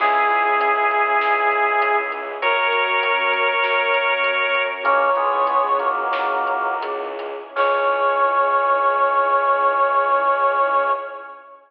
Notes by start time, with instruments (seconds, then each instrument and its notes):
0.00 violin C#2, glockenspiel C#4 E4 G#4, string ensemble 1 C#4 E4 G#4, drawbar organ E4 G#4, brass section G#4, kick, crash
0.30 glockenspiel C#4 E4 G#4, closed hi-hat
0.44 glockenspiel C#4 E4 G#4
0.61 closed hi-hat
0.76 glockenspiel C#4 E4 G#4
0.91 closed hi-hat
1.21 violin C#2, string ensemble 1 G#3 C#4 G#4, glockenspiel C#4 E4 G#4, snare
1.52 closed hi-hat
1.81 glockenspiel C#4 E4 G#4, closed hi-hat
2.12 closed hi-hat
2.42 violin F#2, string ensemble 1 C#4 F#4 A#4, glockenspiel C#4 F#4 A#4, drawbar organ A#4 C#5, brass section A#4, kick, closed hi-hat
2.73 glockenspiel C#4 F#4 A#4, closed hi-hat
2.87 glockenspiel C#4 F#4 A#4
3.03 closed hi-hat
3.18 glockenspiel C#4 F#4 A#4
3.33 kick, closed hi-hat
3.63 violin F#2, string ensemble 1 C#4 A#4 C#5, glockenspiel C#4 F#4 A#4, snare
3.94 closed hi-hat
4.24 glockenspiel C#4 F#4 A#4, closed hi-hat
4.55 closed hi-hat
4.83 violin C#2, drawbar organ A#3 C#4, glockenspiel C#4 E4 G#4, string ensemble 1 C#4 E4 G#4, brass section C#5, kick, closed hi-hat
5.15 drawbar organ G#3 B3, glockenspiel C#4 E4 G#4, closed hi-hat
5.32 glockenspiel C#4 E4 G#4
5.47 closed hi-hat
5.63 glockenspiel C#4 E4 G#4
5.80 drawbar organ F#3 A#3, kick, closed hi-hat
6.13 glockenspiel C#4 E4 G#4, snare
6.47 closed hi-hat
6.82 glockenspiel C#4 E4 G#4, closed hi-hat
7.19 closed hi-hat
7.56 violin C#2, drawbar organ C#4, string ensemble 1 C#4 E4 G#4, glockenspiel C#4 E4 G#4, brass section C#5, kick, crash